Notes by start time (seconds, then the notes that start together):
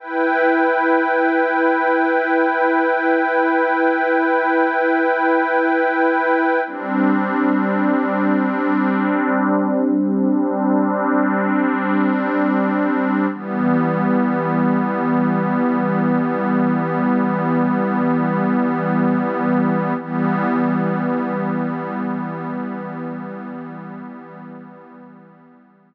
0.00 E4 B4 G5
6.67 G3 C4 D4
13.33 E3 G3 B3
20.00 E3 G3 B3